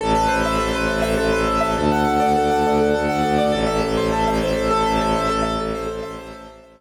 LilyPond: <<
  \new Staff \with { instrumentName = "Acoustic Grand Piano" } { \time 6/8 \key a \dorian \tempo 4. = 136 a'8 b'8 c''8 e''8 a'8 b'8 | c''8 e''8 a'8 b'8 c''8 e''8 | a'8 fis''8 a'8 d''8 a'8 fis''8 | d''8 a'8 a'8 fis''8 a'8 d''8 |
a'8 e''8 a'8 c''8 a'8 e''8 | c''8 a'8 a'8 e''8 a'8 c''8 | a'8 e''8 a'8 c''8 a'8 e''8 | c''8 a'8 a'8 e''8 a'8 r8 | }
  \new Staff \with { instrumentName = "Violin" } { \clef bass \time 6/8 \key a \dorian a,,8 a,,8 a,,8 a,,8 a,,8 a,,8 | a,,8 a,,8 a,,8 a,,8 a,,8 a,,8 | d,8 d,8 d,8 d,8 d,8 d,8 | d,8 d,8 d,8 d,8 d,8 d,8 |
a,,8 a,,8 a,,8 a,,8 a,,8 a,,8 | a,,8 a,,8 a,,8 a,,8 a,,8 a,,8 | a,,8 a,,8 a,,8 a,,8 a,,8 a,,8 | a,,8 a,,8 a,,8 a,,8 a,,8 r8 | }
>>